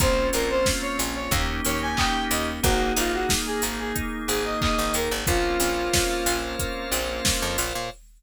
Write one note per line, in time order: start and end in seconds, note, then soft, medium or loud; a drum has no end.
0.00 0.30 A#1 loud
0.00 1.18 A#3 medium
0.00 0.30 A#3 medium
0.00 1.31 A#3 medium
0.00 1.18 C4 medium
0.00 1.31 C4 medium
0.00 1.18 C#4 medium
0.00 1.31 C#4 medium
0.00 1.18 F4 loud
0.00 1.31 F4 medium
0.00 0.28 C5 medium
0.00 kick loud
0.00 closed hi-hat loud
0.33 0.64 A#1 medium
0.33 0.63 C4 medium
0.33 0.49 A#4 medium
0.33 open hi-hat medium
0.50 0.66 C5 medium
0.66 0.96 C#4 medium
0.66 kick medium
0.66 snare loud
0.82 0.98 C#5 medium
0.99 1.29 A#1 medium
0.99 1.29 F4 medium
0.99 open hi-hat medium
1.15 1.31 C#5 medium
1.31 1.61 D#2 loud
1.31 1.62 A#3 loud
1.31 2.62 A#3 medium
1.31 2.51 A#3 medium
1.31 2.63 C#4 medium
1.31 2.51 C#4 loud
1.31 2.62 D#4 medium
1.31 2.51 D#4 loud
1.31 2.63 G4 medium
1.31 2.51 G4 loud
1.31 kick loud
1.31 closed hi-hat loud
1.65 1.95 D#2 medium
1.65 1.95 C#4 medium
1.65 1.81 C#5 medium
1.65 open hi-hat medium
1.82 1.97 G#5 medium
1.97 2.28 D#4 medium
1.97 2.24 G5 medium
1.97 kick medium
1.97 clap loud
2.30 2.60 D#2 loud
2.30 2.60 G4 medium
2.30 2.46 D#5 medium
2.30 open hi-hat medium
2.63 2.93 G#1 loud
2.63 5.24 A#3 medium
2.63 5.00 A#3 loud
2.63 2.93 A#3 loud
2.63 5.24 D#4 medium
2.63 5.00 D#4 loud
2.63 2.92 F#4 medium
2.63 5.24 G#4 medium
2.63 5.00 G#4 medium
2.63 kick loud
2.63 closed hi-hat loud
2.96 3.27 G#1 loud
2.96 3.26 D#4 medium
2.96 3.13 F4 medium
2.96 open hi-hat medium
3.13 3.29 F#4 medium
3.29 3.59 G#4 medium
3.29 kick medium
3.29 snare loud
3.46 3.62 G#4 medium
3.62 3.93 G#1 medium
3.62 3.92 A#3 medium
3.62 open hi-hat medium
3.79 3.95 G#4 medium
3.95 4.25 D#4 medium
3.95 kick medium
3.95 closed hi-hat loud
4.28 4.58 G#1 medium
4.28 4.44 G#4 medium
4.28 4.58 G#4 medium
4.28 open hi-hat medium
4.45 4.60 D#5 medium
4.60 4.91 A#3 medium
4.60 4.92 D#5 medium
4.60 kick medium
4.60 clap loud
4.78 4.93 G#1 loud
4.94 5.09 D#2 medium
4.94 5.24 D#4 medium
4.94 5.11 A#4 medium
4.94 open hi-hat medium
5.11 5.26 G#1 loud
5.27 5.57 A#1 loud
5.27 7.64 A#3 medium
5.27 5.57 A#3 medium
5.27 7.64 C4 medium
5.27 7.64 C#4 medium
5.27 7.64 F4 medium
5.27 6.37 F4 medium
5.27 7.89 A#4 medium
5.27 7.89 C5 medium
5.27 7.89 C#5 medium
5.27 7.89 F5 medium
5.27 kick loud
5.27 closed hi-hat loud
5.60 5.89 A#1 medium
5.60 5.90 C4 medium
5.60 open hi-hat medium
5.93 6.23 C#4 medium
5.93 kick medium
5.93 snare loud
6.26 6.56 A#1 medium
6.26 6.56 F4 medium
6.26 open hi-hat medium
6.59 6.89 A#3 medium
6.59 kick medium
6.59 closed hi-hat loud
6.92 7.21 A#1 loud
6.92 7.22 C4 medium
6.92 open hi-hat medium
7.25 7.55 C#4 medium
7.25 kick medium
7.25 snare loud
7.42 7.57 F2 loud
7.58 7.73 A#1 loud
7.58 7.88 F4 medium
7.58 open hi-hat medium
7.75 7.90 A#2 medium